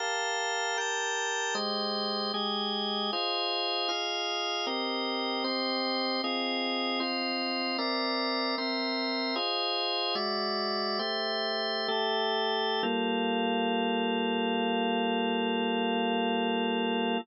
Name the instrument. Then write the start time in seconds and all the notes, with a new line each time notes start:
drawbar organ
0.00 G4 A#4 F5 A5
0.78 G4 A#4 G5 A5
1.55 G#3 G4 C5 D#5
2.34 G#3 G4 G#4 D#5
3.13 F4 G#4 C5 D#5
3.89 F4 G#4 D#5 F5
4.67 C4 G4 A#4 D#5
5.44 C4 G4 C5 D#5
6.24 C4 F4 G#4 D#5
7.00 C4 F4 C5 D#5
7.78 C4 A#4 D5 E5
8.58 C4 A#4 C5 E5
9.36 F4 G#4 C5 D#5
10.15 G#3 F#4 D5 E5
10.99 A3 G4 C5 E5
11.88 A3 G4 A4 E5
12.83 G3 A#3 F4 A4